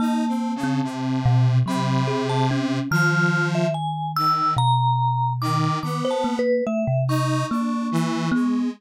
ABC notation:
X:1
M:7/8
L:1/16
Q:1/4=72
K:none
V:1 name="Kalimba"
^A,3 C3 B,,2 ^F,2 ^G2 ^C2 | ^D,8 B,,6 | ^D, c ^A,2 =A, C,3 ^A,4 B,2 |]
V:2 name="Lead 1 (square)"
(3^D2 C2 ^C,2 =C,4 C,6 | F,4 z2 ^D,2 z4 D,2 | B,3 z3 ^D2 =D2 E,2 ^G,2 |]
V:3 name="Vibraphone"
a8 b3 a z2 | f'3 e ^g2 e'2 ^a4 d'2 | (3d'2 a2 B2 e2 ^c'8 |]